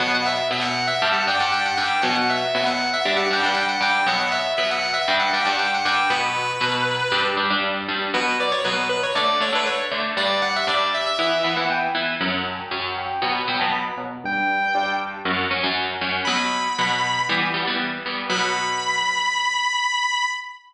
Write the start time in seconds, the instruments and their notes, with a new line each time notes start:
0.00 overdriven guitar B2 F#3 B3, distortion guitar F#5
0.14 distortion guitar F#5
0.25 distortion guitar E5
0.51 overdriven guitar B2 F#3 B3, distortion guitar E5
0.61 distortion guitar F#5
0.87 distortion guitar E5
1.02 overdriven guitar G2 G3 D4
1.13 distortion guitar F#5
1.27 overdriven guitar G2 G3 D4, distortion guitar G5
1.40 overdriven guitar G2 G3 D4, distortion guitar F#5
1.52 distortion guitar G5
1.65 distortion guitar F#5
1.77 overdriven guitar G2 G3 D4, distortion guitar G5
2.02 overdriven guitar B2 F#3 B3, distortion guitar F#5
2.15 distortion guitar F#5
2.30 distortion guitar E5
2.55 overdriven guitar B2 F#3 B3, distortion guitar E5
2.66 distortion guitar F#5
2.93 distortion guitar E5
3.05 overdriven guitar G2 G3 D4
3.17 distortion guitar F#5
3.31 overdriven guitar G2 G3 D4, distortion guitar G5
3.43 overdriven guitar G2 G3 D4, distortion guitar F#5
3.54 distortion guitar G5
3.68 distortion guitar F#5
3.81 overdriven guitar G2 G3 D4, distortion guitar G5
4.07 overdriven guitar B2 F#3 B3, distortion guitar F#5
4.19 distortion guitar F#5
4.31 distortion guitar E5
4.57 overdriven guitar B2 F#3 B3, distortion guitar E5
4.71 distortion guitar F#5
4.94 distortion guitar E5
5.08 overdriven guitar G2 G3 D4
5.19 distortion guitar F#5
5.33 overdriven guitar G2 G3 D4, distortion guitar G5
5.45 overdriven guitar G2 G3 D4, distortion guitar F#5
5.59 distortion guitar G5
5.74 distortion guitar F#5
5.85 overdriven guitar G2 G3 D4, distortion guitar G5
6.10 overdriven guitar B2 F#3 B3, distortion guitar B4
6.61 overdriven guitar B2 F#3 B3
7.12 overdriven guitar G2 G3 D4
7.37 overdriven guitar G2 G3 D4
7.50 overdriven guitar G2 G3 D4
7.88 overdriven guitar G2 G3 D4
8.14 overdriven guitar B2 F#3 B3, distortion guitar B4
8.40 distortion guitar D5
8.51 distortion guitar C#5
8.64 overdriven guitar B2 F#3 B3, distortion guitar B4
8.89 distortion guitar B4
9.03 distortion guitar C#5
9.15 overdriven guitar D3 A3 D4, distortion guitar D5
9.40 overdriven guitar D3 A3 D4, distortion guitar C#5
9.52 overdriven guitar D3 A3 D4, distortion guitar B4
9.66 distortion guitar C#5
9.91 overdriven guitar D3 A3 D4
10.17 overdriven guitar G2 G3 D4, distortion guitar D5
10.42 distortion guitar F#5
10.56 distortion guitar E5
10.67 overdriven guitar G2 G3 D4, distortion guitar D5
10.94 distortion guitar E5
11.06 distortion guitar E5
11.19 overdriven guitar E3 B3 E4, distortion guitar E5
11.43 overdriven guitar E3 B3 E4, distortion guitar E5
11.56 overdriven guitar E3 B3 E4, distortion guitar F#5
11.70 distortion guitar G5
11.95 overdriven guitar E3 B3 E4
12.21 overdriven guitar F#2 F#3 C#4, distortion guitar F#5
12.47 distortion guitar A5
12.59 distortion guitar G5
12.71 overdriven guitar F#2 F#3 C#4, distortion guitar F#5
12.97 distortion guitar G5
13.10 distortion guitar G5
13.22 overdriven guitar B2 F#3 B3, distortion guitar B5
13.48 overdriven guitar B2 F#3 B3, distortion guitar G5
13.59 overdriven guitar B2 F#3 B3, distortion guitar A5
13.72 distortion guitar B5
13.98 overdriven guitar B2 F#3 B3
14.24 overdriven guitar G2 G3 D4, distortion guitar G5
14.75 overdriven guitar G2 G3 D4
15.25 overdriven guitar F#2 F#3 C#4
15.51 overdriven guitar F#2 F#3 C#4
15.64 overdriven guitar F#2 F#3 C#4
16.01 overdriven guitar F#2 F#3 C#4
16.25 overdriven guitar B2 F#3 B3, distortion guitar B5
16.78 overdriven guitar B2 F#3 B3
17.29 overdriven guitar E3 G3 B3
17.54 overdriven guitar E3 G3 B3
17.67 overdriven guitar E3 G3 B3
18.06 overdriven guitar E3 G3 B3
18.30 overdriven guitar B2 F#3 B3, distortion guitar B5